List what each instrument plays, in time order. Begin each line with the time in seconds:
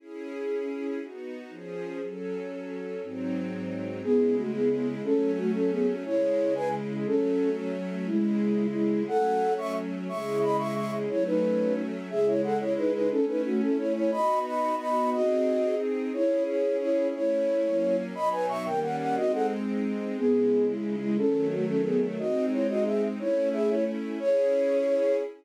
0.00 string ensemble 1 C#4 E4 G#4
1.01 string ensemble 1 B3 D#4 F#4
1.50 string ensemble 1 F3 C#4 G#4
2.02 string ensemble 1 F#3 C#4 A4
3.01 string ensemble 1 G#2 F#3 C4 D#4
4.02 string ensemble 1 C#3 G#3 E4, flute B3 G#4
4.36 flute A3 F#4
4.54 flute B3 G#4
4.71 flute B3 G#4
5.03 string ensemble 1 F#3 A3 C#4, flute C#4 A4
5.38 flute A3 F#4
5.55 flute C#4 A4
5.71 flute B3 G#4
6.05 string ensemble 1 C#3 G#3 E4, flute E4 C#5
6.55 flute B4 G#5
7.06 string ensemble 1 F#3 A3 C#4, flute C#4 A4
8.07 string ensemble 1 C#3 G#3 E4, flute G#3 E4
8.74 flute G#3 E4
9.08 string ensemble 1 F#3 A3 C#4, flute A4 F#5
9.58 flute E5 C#6
10.09 string ensemble 1 C#3 G#3 E4, flute E5 C#6
10.43 flute D#5 B5
10.58 flute E5 C#6
10.76 flute E5 C#6
11.09 string ensemble 1 F#3 A3 C#4, flute E4 C#5
11.26 flute D#4 B4
12.10 string ensemble 1 C#3 G#3 E4, flute G#4 E5
12.27 flute E4 C#5
12.44 flute A4 F#5
12.60 flute E4 C#5
12.77 flute D#4 B4
12.94 flute D#4 B4
13.10 string ensemble 1 A3 C#4 E4, flute C#4 A4
13.28 flute D#4 B4
13.45 flute A3 F#4
13.61 flute C#4 A4
13.78 flute E4 C#5
13.95 flute E4 C#5
14.12 string ensemble 1 B3 D#4 F#4, flute D#5 B5
14.45 flute D#5 B5
14.79 flute D#5 B5
15.12 string ensemble 1 C4 D#4 G#4, flute F#4 D#5
16.13 string ensemble 1 C#4 E4 G#4, flute E4 C#5
16.47 flute E4 C#5
16.81 flute E4 C#5
17.14 string ensemble 1 A3 C#4 E4, flute E4 C#5
17.64 string ensemble 1 F#3 A#3 C#4
18.15 string ensemble 1 B2 F#3 D#4, flute D#5 B5
18.32 flute B4 G#5
18.49 flute E5 C#6
18.65 string ensemble 1 D#3 G3 A#3 C#4, flute A#4 G5
18.82 flute F#5
18.99 flute F#5
19.16 string ensemble 1 G#3 C4 D#4, flute F#4 D#5
19.33 flute A4 F#5
20.17 string ensemble 1 C#3 G#3 E4, flute B3 G#4
20.67 flute G#3 E4
21.01 flute G#3 E4
21.17 string ensemble 1 D#3 F#3 A3, flute C#4 A4
21.51 flute A3 F#4
21.68 flute C#4 A4
21.85 flute B3 G#4
22.18 string ensemble 1 G#3 C4 D#4, flute F#4 D#5
22.52 flute E4 C#5
22.69 flute F#4 D#5
22.86 flute G#4 E5
23.19 string ensemble 1 A3 C#4 E4, flute E4 C#5
23.53 flute G#4 E5
23.70 flute E4 C#5
24.20 string ensemble 1 C#4 E4 G#4, flute C#5